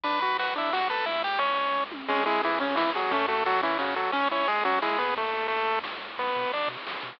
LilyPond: <<
  \new Staff \with { instrumentName = "Lead 1 (square)" } { \time 3/4 \key b \minor \tempo 4 = 176 <b' b''>8 <b' b''>8 <fis' fis''>8 <e' e''>8 <fis' fis''>8 <a' a''>8 | <e' e''>8 <g' g''>8 <cis' cis''>4. r8 | \key cis \minor <gis gis'>8 <gis gis'>8 <e e'>8 <cis cis'>8 <e e'>8 <fis fis'>8 | <a a'>8 <a a'>8 <fis fis'>8 <e e'>8 <cis cis'>8 <fis fis'>8 |
<cis' cis''>8 <cis' cis''>8 <gis gis'>8 <fis fis'>8 <gis gis'>8 <b b'>8 | <a a'>4 <a a'>4 r4 | \key b \minor <b b'>4 <d' d''>8 r4. | }
  \new Staff \with { instrumentName = "Lead 1 (square)" } { \time 3/4 \key b \minor d'8 fis'8 b'8 d'8 fis'8 b'8 | r2. | \key cis \minor cis'8 e'8 gis'8 cis'8 e'8 gis'8 | cis'8 fis'8 a'8 cis'8 fis'8 a'8 |
cis'8 e'8 gis'8 cis'8 e'8 gis'8 | r2. | \key b \minor r2. | }
  \new Staff \with { instrumentName = "Synth Bass 1" } { \clef bass \time 3/4 \key b \minor b,,4 b,,2 | cis,4 cis,2 | \key cis \minor cis,4 cis,2 | fis,4 fis,2 |
cis,4 cis,4. dis,8~ | dis,4 dis,4 cis,8 bis,,8 | \key b \minor b,,8 b,8 b,,8 b,8 b,,8 b,8 | }
  \new DrumStaff \with { instrumentName = "Drums" } \drummode { \time 3/4 <bd cymr>8 cymr8 cymr8 cymr8 sn8 cymr8 | <bd cymr>8 cymr8 cymr8 cymr8 bd8 tommh8 | <cymc bd>8 cymr8 cymr8 cymr8 sn8 cymr8 | <bd cymr>8 cymr8 cymr8 cymr8 sn8 cymr8 |
<bd cymr>8 cymr8 cymr8 cymr8 sn8 cymr8 | <bd cymr>8 cymr8 cymr8 cymr8 sn8 cymr8 | <cymc bd>16 cymr16 cymr16 cymr16 cymr16 cymr16 cymr16 cymr16 sn16 cymr16 cymr16 cymr16 | }
>>